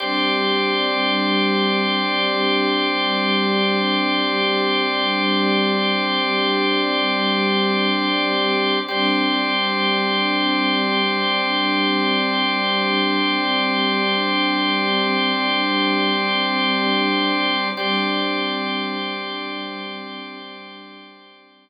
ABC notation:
X:1
M:4/4
L:1/8
Q:1/4=54
K:G
V:1 name="String Ensemble 1"
[G,CD]8- | [G,CD]8 | [G,CD]8- | [G,CD]8 |
[G,CD]8 |]
V:2 name="Drawbar Organ"
[Gcd]8- | [Gcd]8 | [Gcd]8- | [Gcd]8 |
[Gcd]8 |]